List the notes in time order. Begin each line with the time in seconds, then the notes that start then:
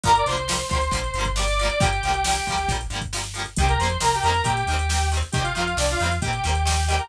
0.03 G1 D3 F3 G3 A#4 A#5, kick, closed hi-hat
0.09 A#3
0.15 D5 D6, closed hi-hat
0.26 C2 D3 F3 C5 C6, closed hi-hat
0.31 G3 A#3
0.37 closed hi-hat
0.48 D3 F3 G3, snare
0.53 A#3
0.59 closed hi-hat
0.69 D2 D3 F3 G3 C5 C6, kick, closed hi-hat
0.75 A#3
0.81 closed hi-hat
0.91 A#1 D3 F3 G3, kick, closed hi-hat
0.96 A#3
1.04 closed hi-hat
1.14 G1 D3 F3, closed hi-hat
1.19 G3 A#3
1.25 kick, closed hi-hat
1.36 D3 F3 G3 D5 D6, snare
1.41 A#3
1.47 D5 D6, closed hi-hat
1.59 D3 F3 G3, closed hi-hat
1.65 A#3 D5 D6
1.70 closed hi-hat
1.80 G1 D3 F3 G3 G4 G5, kick, closed hi-hat
1.85 A#3
1.92 closed hi-hat
2.03 C2 D3 F3, closed hi-hat
2.07 G3 A#3
2.13 closed hi-hat
2.24 D3 F3, snare
2.29 G3 A#3
2.35 closed hi-hat
2.47 D2 D3 F3 G3, kick, closed hi-hat
2.52 A#3
2.58 closed hi-hat
2.68 A#1 D3 F3 G3, kick, closed hi-hat
2.74 A#3
2.81 closed hi-hat
2.90 G1 D3 F3 G3, closed hi-hat
2.95 A#3
3.01 kick, closed hi-hat
3.13 D3 F3 G3, snare
3.18 A#3
3.23 closed hi-hat
3.34 D3 F3 G3, closed hi-hat
3.39 A#3
3.45 closed hi-hat
3.56 C2 D#3 G3 G4 G5, kick, closed hi-hat
3.62 A#3 C4
3.68 A#4 A#5, closed hi-hat
3.79 F2 D#3 G3 C5 C6, closed hi-hat
3.83 A#3 C4
3.89 closed hi-hat
4.00 C2 D#3 G3 A#3 A#4 A#5, snare
4.06 C4
4.13 G4 G5, closed hi-hat
4.23 F2 D#3 G3 A#4 A#5, closed hi-hat
4.27 A#3 C4
4.34 closed hi-hat
4.44 A#2 D#3 G3 A#3 G4 G5, kick, closed hi-hat
4.49 C4
4.57 closed hi-hat
4.67 D#2 D#3 G3, closed hi-hat
4.72 A#3 C4
4.79 closed hi-hat
4.89 D#3 G3 A#3, snare
4.94 C4
5.01 closed hi-hat
5.12 D#3 G3 A#3, closed hi-hat
5.17 C4
5.22 closed hi-hat
5.32 C2 D#3 G3 G4 G5, kick, closed hi-hat
5.37 A#3 C4
5.43 F4 F5, closed hi-hat
5.55 F2 D#3 G3 A#3 F4 F5, closed hi-hat
5.60 C4
5.67 closed hi-hat
5.77 C2 D#3 G3 A#3 D4 D5, snare
5.82 C4
5.88 F4 F5, closed hi-hat
5.99 F2 D#3 G3, closed hi-hat
6.04 A#3 C4
6.11 closed hi-hat
6.21 A#2 D#3 G3 G4 G5, kick, closed hi-hat
6.26 A#3 C4
6.33 closed hi-hat
6.44 D#2 D#3 G3 A#3, closed hi-hat
6.49 C4
6.55 closed hi-hat
6.65 D#3 G3 G4 G5, snare
6.69 A#3 C4
6.77 closed hi-hat
6.88 D#3 G3 A#3 G4 G5, closed hi-hat
6.94 C4
6.99 A#4 A#5, closed hi-hat